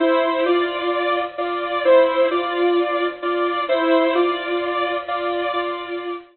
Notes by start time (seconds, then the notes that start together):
0.00 E4 C5
0.46 F4 D5
1.38 F4 D5
1.85 E4 C5
2.31 F4 D5
3.22 F4 D5
3.69 E4 C5
4.15 F4 D5
5.08 F4 D5
5.53 F4 D5